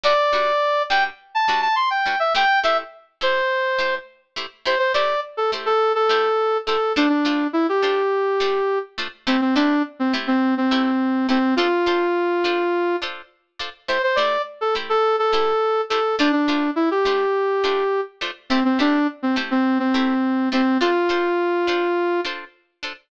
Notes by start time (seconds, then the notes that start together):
0.03 G3 D4 F#4 B4 D5
0.33 G3 D4 F#4 B4
0.90 G3 D4 F#4 B4 G5
1.35 A5
1.48 G3 D4 F#4 B4
1.62 A5
1.76 C6
1.90 G5
2.06 G3 D4 F#4 B4
2.20 E5
2.35 A3 E4 G4 C5 G5
2.64 A3 E4 G4 C5 E5
3.21 A3 E4 G4 C5
3.79 A3 E4 G4 C5
4.36 A3 E4 G4 C5
4.66 A3 E4 G4 C5
4.79 C5
4.94 A3 E4 G4 C5 D5
5.37 A4
5.52 A3 E4 G4 C5
5.66 A4
5.95 A4
6.09 A3 E4 G4 C5
6.67 A3 E4 G4 A4 C5
6.96 A3 D4 F4 C5
7.09 D4
7.25 A3 D4 F4 C5
7.53 E4
7.69 G4
7.82 A3 D4 F4 C5
8.40 A3 D4 F4 C5
8.98 A3 D4 F4 C5
9.27 A3 C4 E4 G4 C5
9.41 C4
9.55 A3 D4 E4 G4 C5
10.00 C4
10.13 A3 E4 G4 C5
10.27 C4
10.57 C4
10.71 A3 E4 G4 C5
11.29 A3 C4 E4 G4 C5
11.56 D4 F4 A4 C5
11.86 D4 F4 A4 C5
12.44 D4 F4 A4 C5
13.02 D4 F4 A4 C5
13.59 D4 F4 A4 C5
13.88 A3 E4 G4 C5
14.03 C5
14.16 A3 E4 G4 C5 D5
14.61 A4
14.75 A3 E4 G4 C5
14.89 A4
15.19 A4
15.33 A3 E4 G4 C5
15.90 A3 E4 G4 A4 C5
16.19 A3 D4 F4 C5
16.32 D4
16.48 A3 D4 F4 C5
16.76 E4
16.91 G4
17.05 A3 D4 F4 C5
17.64 A3 D4 F4 C5
18.21 A3 D4 F4 C5
18.50 A3 C4 E4 G4 C5
18.65 C4
18.79 A3 D4 E4 G4 C5
19.23 C4
19.36 A3 E4 G4 C5
19.51 C4
19.79 C4
19.94 A3 E4 G4 C5
20.52 A3 C4 E4 G4 C5
20.81 D4 F4 A4 C5
21.09 D4 F4 A4 C5
21.67 D4 F4 A4 C5
22.25 D4 F4 A4 C5
22.83 D4 F4 A4 C5